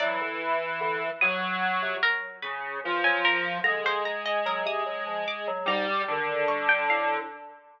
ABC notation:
X:1
M:9/8
L:1/16
Q:3/8=49
K:none
V:1 name="Lead 1 (square)" clef=bass
E,6 ^F,4 z2 ^C,2 =F,4 | ^G,10 =G,2 D,6 |]
V:2 name="Harpsichord"
d6 ^d'4 ^A2 B3 ^g A2 | ^a c a ^d ^A ^d'3 =d'2 a4 ^c' g f2 |]
V:3 name="Electric Piano 2" clef=bass
^F, D, z2 D, z4 C, z4 E, F, z2 | D, D, z2 ^F, C, F, =F, z ^F, ^G,, z ^D,2 =G,2 A,,2 |]